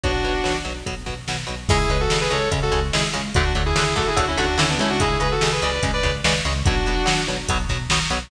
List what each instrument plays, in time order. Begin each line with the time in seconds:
0.03 synth bass 1 B1, overdriven guitar B2 F#3, distortion guitar D4 F#4, kick, closed hi-hat
0.24 synth bass 1 B1, overdriven guitar B2 F#3, closed hi-hat
0.44 synth bass 1 B1, overdriven guitar B2 F#3, snare
0.65 synth bass 1 B1, overdriven guitar B2 F#3, closed hi-hat
0.86 synth bass 1 B1, overdriven guitar B2 F#3, kick, closed hi-hat
1.06 synth bass 1 B1, overdriven guitar B2 F#3, kick, snare, closed hi-hat
1.27 synth bass 1 B1, overdriven guitar B2 F#3, snare
1.47 synth bass 1 B1, overdriven guitar B2 F#3, closed hi-hat
1.68 synth bass 1 C#2, overdriven guitar C#3 G#3, distortion guitar E4 G#4, kick, crash
1.90 synth bass 1 C#2, overdriven guitar C#3 G#3, distortion guitar G#4 B4, closed hi-hat
2.00 distortion guitar F#4 A4
2.10 synth bass 1 C#2, overdriven guitar C#3 G#3, snare
2.21 distortion guitar G#4 B4
2.30 synth bass 1 C#2, overdriven guitar C#3 G#3, distortion guitar A4 C#5, closed hi-hat
2.51 synth bass 1 C#2, overdriven guitar C#3 G#3, kick, closed hi-hat
2.62 distortion guitar F#4 A4
2.72 synth bass 1 C#2, overdriven guitar C#3 G#3, snare, closed hi-hat
2.93 synth bass 1 C#2, overdriven guitar C#3 G#3, distortion guitar E4 G#4, snare
3.13 synth bass 1 C#2, overdriven guitar C#3 G#3, closed hi-hat
3.34 synth bass 1 D2, overdriven guitar D3 F#3 A3, distortion guitar D4 F#4, kick, closed hi-hat
3.55 synth bass 1 D2, overdriven guitar D3 F#3 A3, closed hi-hat
3.66 distortion guitar E4 G#4
3.76 synth bass 1 D2, overdriven guitar D3 F#3 A3, snare
3.96 synth bass 1 D2, overdriven guitar D3 F#3 A3, distortion guitar F#4 A4, kick, closed hi-hat
4.07 distortion guitar E4 G#4
4.16 synth bass 1 D2, overdriven guitar D3 F#3 A3, distortion guitar D4 F#4, kick, closed hi-hat
4.27 distortion guitar C#4 E4
4.37 synth bass 1 D2, overdriven guitar D3 F#3 A3, distortion guitar D4 F#4, snare, closed hi-hat
4.57 synth bass 1 D2, overdriven guitar D3 F#3 A3, distortion guitar C#4 E4, snare
4.69 distortion guitar B3 D4
4.78 synth bass 1 C#2, overdriven guitar D3 F#3 A3, distortion guitar C#4 E4, closed hi-hat
4.89 distortion guitar D4 F#4
5.00 overdriven guitar C#3 G#3, distortion guitar E4 G#4, kick, closed hi-hat
5.20 synth bass 1 C#2, overdriven guitar C#3 G#3, distortion guitar G#4 B4, closed hi-hat
5.31 distortion guitar F#4 A4
5.41 synth bass 1 C#2, overdriven guitar C#3 G#3, snare
5.52 distortion guitar G#4 B4
5.62 synth bass 1 C#2, overdriven guitar C#3 G#3, distortion guitar B4 D5, closed hi-hat
5.83 synth bass 1 C#2, overdriven guitar C#3 G#3, kick, closed hi-hat
5.93 distortion guitar B4 D5
6.03 synth bass 1 C#2, overdriven guitar C#3 G#3, kick, snare, closed hi-hat
6.24 synth bass 1 C#2, overdriven guitar C#3 G#3, distortion guitar B4 D5, snare
6.45 synth bass 1 C#2, overdriven guitar C#3 G#3, closed hi-hat
6.65 synth bass 1 B1, overdriven guitar B2 F#3, distortion guitar D4 F#4, kick, closed hi-hat
6.86 synth bass 1 B1, overdriven guitar B2 F#3, closed hi-hat
7.06 synth bass 1 B1, overdriven guitar B2 F#3, snare
7.27 synth bass 1 B1, overdriven guitar B2 F#3, closed hi-hat
7.48 synth bass 1 B1, overdriven guitar B2 F#3, kick, closed hi-hat
7.69 synth bass 1 B1, overdriven guitar B2 F#3, kick, snare, closed hi-hat
7.89 synth bass 1 B1, overdriven guitar B2 F#3, snare
8.10 synth bass 1 B1, overdriven guitar B2 F#3, closed hi-hat